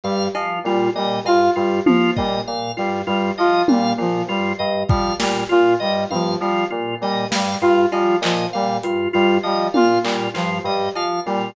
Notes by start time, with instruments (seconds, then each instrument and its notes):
0.04 electric piano 2 G2, lead 2 (sawtooth) G3, drawbar organ F5
0.35 electric piano 2 F3, drawbar organ F4, cowbell
0.64 electric piano 2 A#2, lead 2 (sawtooth) G3, drawbar organ F4
0.95 electric piano 2 A#2, lead 2 (sawtooth) G3, drawbar organ D#5
1.24 electric piano 2 G2, lead 2 (sawtooth) F4, drawbar organ F5, cowbell
1.56 electric piano 2 G2, lead 2 (sawtooth) G3, drawbar organ F4
1.86 electric piano 2 F3, lead 2 (sawtooth) F3, drawbar organ F4, high tom
2.16 electric piano 2 A#2, lead 2 (sawtooth) G3, drawbar organ D#5, kick
2.47 electric piano 2 A#2, drawbar organ F5
2.77 electric piano 2 G2, lead 2 (sawtooth) G3, drawbar organ F4
3.07 electric piano 2 G2, lead 2 (sawtooth) G3, drawbar organ F4
3.38 electric piano 2 F3, lead 2 (sawtooth) F4, drawbar organ D#5
3.68 electric piano 2 A#2, lead 2 (sawtooth) G3, drawbar organ F5, high tom
3.98 electric piano 2 A#2, lead 2 (sawtooth) F3, drawbar organ F4
4.28 electric piano 2 G2, lead 2 (sawtooth) G3, drawbar organ F4
4.59 electric piano 2 G2, drawbar organ D#5
4.88 electric piano 2 F3, lead 2 (sawtooth) G3, drawbar organ F5, kick
5.19 electric piano 2 A#2, lead 2 (sawtooth) G3, drawbar organ F4, snare
5.49 electric piano 2 A#2, drawbar organ F4, lead 2 (sawtooth) F4
5.80 electric piano 2 G2, lead 2 (sawtooth) G3, drawbar organ D#5
6.10 electric piano 2 G2, lead 2 (sawtooth) F3, drawbar organ F5, high tom
6.40 electric piano 2 F3, lead 2 (sawtooth) G3, drawbar organ F4
6.70 electric piano 2 A#2, drawbar organ F4
7.01 electric piano 2 A#2, lead 2 (sawtooth) G3, drawbar organ D#5
7.31 electric piano 2 G2, lead 2 (sawtooth) G3, drawbar organ F5, snare
7.61 electric piano 2 G2, lead 2 (sawtooth) F4, drawbar organ F4
7.91 electric piano 2 F3, lead 2 (sawtooth) G3, drawbar organ F4, cowbell
8.21 electric piano 2 A#2, lead 2 (sawtooth) F3, drawbar organ D#5, clap
8.53 electric piano 2 A#2, lead 2 (sawtooth) G3, drawbar organ F5
8.83 electric piano 2 G2, drawbar organ F4, closed hi-hat
9.13 electric piano 2 G2, lead 2 (sawtooth) G3, drawbar organ F4
9.43 electric piano 2 F3, lead 2 (sawtooth) G3, drawbar organ D#5
9.74 electric piano 2 A#2, lead 2 (sawtooth) F4, drawbar organ F5, high tom
10.03 electric piano 2 A#2, lead 2 (sawtooth) G3, drawbar organ F4, clap
10.34 electric piano 2 G2, lead 2 (sawtooth) F3, drawbar organ F4, clap
10.64 electric piano 2 G2, lead 2 (sawtooth) G3, drawbar organ D#5
10.95 electric piano 2 F3, drawbar organ F5, cowbell
11.26 electric piano 2 A#2, lead 2 (sawtooth) G3, drawbar organ F4